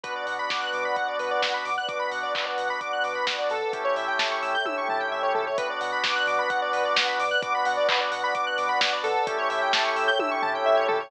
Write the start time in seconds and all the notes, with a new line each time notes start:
0.04 B1 B3 D4 F#4 B4 D5 F#5, kick, closed hi-hat
0.15 D5
0.27 B2 F#5, open hi-hat
0.39 B5
0.50 B1 D6, kick, snare
0.61 F#6
0.73 B2 D6, open hi-hat
0.85 B5
0.96 B1 F#5, kick, closed hi-hat
1.08 D5
1.19 B2 B4, open hi-hat
1.31 D5
1.42 B1 F#5, kick, snare
1.54 B5
1.65 B2 D6, open hi-hat
1.78 F#6
1.88 B1 B3 D4 F#4 D6, kick, closed hi-hat
2.00 B5
2.12 B2 F#5, open hi-hat
2.23 D5
2.35 B1 B4, kick, clap
2.46 D5
2.58 B2 F#5, open hi-hat
2.70 B5
2.81 B1 D6, kick, closed hi-hat
2.93 F#6
3.04 B2 D6, open hi-hat
3.15 B5
3.27 B1 F#5, kick, snare
3.39 D5
3.50 B2 A4, open hi-hat
3.73 A1 A3 C#4 E4 G4 A4 C#5 E5 G5, kick, closed hi-hat
3.85 C#5
3.96 A2 E5, open hi-hat
4.08 G5
4.19 A1 A5, kick, snare
4.31 C#6
4.42 A2 E6, open hi-hat
4.55 G6
4.65 A1 A3 C#4 E4 G4 E6, kick, high tom
4.77 C#6
4.88 A2 A5, floor tom
5.00 G5
5.11 A2 E5
5.23 C#5
5.35 A#2 A4, floor tom
5.47 C#5
5.58 B1 B3 D4 F#4 B4 D5 F#5, kick, closed hi-hat
5.70 D5
5.81 B2 F#5, open hi-hat
5.92 B5
6.04 B1 D6, kick, snare
6.16 F#6
6.27 B2 D6, open hi-hat
6.39 B5
6.50 B1 F#5, kick, closed hi-hat
6.62 D5
6.73 B2 B4, open hi-hat
6.85 D5
6.96 B1 F#5, kick, snare
7.07 B5
7.19 B2 D6, open hi-hat
7.31 F#6
7.42 B1 B3 D4 F#4 D6, kick, closed hi-hat
7.55 B5
7.65 B2 F#5, open hi-hat
7.77 D5
7.89 B1 B4, kick, clap
8.00 D5
8.11 B2 F#5, open hi-hat
8.24 B5
8.35 B1 D6, kick, closed hi-hat
8.47 F#6
8.58 B2 D6, open hi-hat
8.69 B5
8.81 B1 F#5, kick, snare
8.92 D5
9.04 B2 A4, open hi-hat
9.27 A1 A3 C#4 E4 G4 A4 C#5 E5 G5, kick, closed hi-hat
9.38 C#5
9.50 A2 E5, open hi-hat
9.62 G5
9.73 A1 A5, kick, snare
9.85 C#6
9.96 A2 E6, open hi-hat
10.08 G6
10.19 A1 A3 C#4 E4 G4 E6, kick, high tom
10.31 C#6
10.42 A2 A5, floor tom
10.55 G5
10.66 A2 E5
10.77 C#5
10.88 A#2 A4, floor tom
11.00 C#5